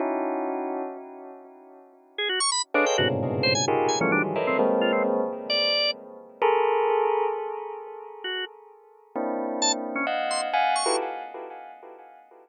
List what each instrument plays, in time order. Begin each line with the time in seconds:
0.00 tubular bells C#4 D#4 E4 F#4
2.18 drawbar organ G#4
2.29 drawbar organ F#4
2.40 drawbar organ C#6
2.52 drawbar organ B5
2.74 drawbar organ D4, tubular bells G#4 A4 B4 C#5 D#5 F5
2.86 drawbar organ G5
2.98 tubular bells G2 G#2 A#2 B2 C3 C#3, drawbar organ F#4
3.43 drawbar organ C5
3.55 drawbar organ G#5
3.68 tubular bells D#4 F4 G4 G#4 A#4
3.89 drawbar organ G#5
4.01 tubular bells E3 F3 G3 A3, drawbar organ C#4
4.12 tubular bells D#3 E3 F#3 G3, drawbar organ D4
4.36 tubular bells A4 A#4 B4 C#5 D#5 E5
4.47 drawbar organ C4
4.59 tubular bells G#3 A#3 C4
4.81 drawbar organ F4
4.92 drawbar organ C4
5.50 drawbar organ D5
6.42 tubular bells G#4 A4 A#4
8.24 drawbar organ F#4
9.16 tubular bells A#3 C4 D4 E4
9.62 drawbar organ A5
9.96 drawbar organ C#4
10.07 tubular bells D#5 F5 F#5
10.31 drawbar organ C6
10.54 tubular bells F5 F#5 G#5
10.76 drawbar organ C#6
10.86 tubular bells E4 F4 F#4 G4 A4 B4